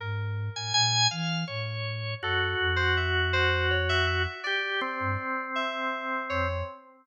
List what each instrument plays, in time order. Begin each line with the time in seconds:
0.00 ocarina G#2, electric piano 2 A#4
0.56 ocarina A2, drawbar organ G#5
0.74 ocarina A#2, drawbar organ G#5
1.11 ocarina E3, drawbar organ F5
1.48 ocarina A2, drawbar organ C#5
2.22 ocarina F#2, drawbar organ F#4, electric piano 2 A4
2.60 ocarina F2
2.76 electric piano 2 C5
2.97 electric piano 2 E5
3.33 electric piano 2 C5
3.71 electric piano 2 C#5
3.89 electric piano 2 E5
4.07 electric piano 2 E5
4.44 drawbar organ G4, electric piano 2 D5
4.81 drawbar organ C4
5.00 ocarina G2
5.55 electric piano 2 E5
6.30 ocarina F2, electric piano 2 C#5